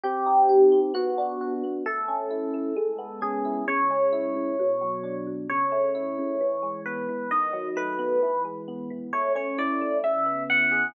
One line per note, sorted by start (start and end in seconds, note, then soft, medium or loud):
0.03 0.71 C4 medium
0.03 0.79 G4 loud
0.26 0.91 D#4 medium
0.49 0.92 G4 medium
0.72 0.94 C4 medium
0.94 1.63 B3 medium
0.94 1.53 F#4 medium
1.18 1.82 D4 medium
1.41 1.84 F#4 medium
1.64 1.85 B3 medium
1.86 2.53 A3 medium
1.86 3.19 A4 loud
2.08 2.73 C#4 medium
2.30 2.74 E4 medium
2.54 2.75 A3 medium
2.76 3.63 G#3 medium
2.98 3.63 B3 medium
3.21 3.64 C#4 medium
3.21 3.64 G#4 loud
3.45 3.66 E4 medium
3.68 4.34 C#3 medium
3.68 5.15 C#5 loud
3.90 4.55 G#3 medium
4.12 4.56 E4 medium
4.35 4.56 C#3 medium
4.59 5.26 B2 medium
4.81 5.46 F#3 medium
5.03 5.47 D4 medium
5.27 5.48 B2 medium
5.49 6.18 C#3 medium
5.49 6.81 C#5 loud
5.72 6.36 A3 medium
5.95 6.38 E4 medium
6.18 6.40 C#3 medium
6.41 7.08 E3 medium
6.62 7.27 G#3 medium
6.86 7.29 B3 medium
6.86 7.30 B4 medium
7.09 7.30 E3 medium
7.31 8.18 D#3 medium
7.31 7.68 D#5 loud
7.53 8.18 F#3 medium
7.76 8.19 A3 medium
7.76 8.43 B4 loud
7.99 8.20 B3 medium
8.22 8.90 E3 medium
8.45 9.09 G#3 medium
8.68 9.11 B3 medium
8.90 9.12 E3 medium
9.13 9.81 A3 medium
9.13 9.32 C#5 loud
9.35 10.00 C#4 medium
9.35 9.57 C#5 loud
9.58 10.01 E4 medium
9.58 9.97 D5 loud
9.81 10.03 A3 medium
10.04 10.90 C#3 medium
10.04 10.43 E5 loud
10.26 10.90 B3 medium
10.50 10.93 E4 medium
10.50 10.87 F#5 loud
10.71 10.93 G#4 medium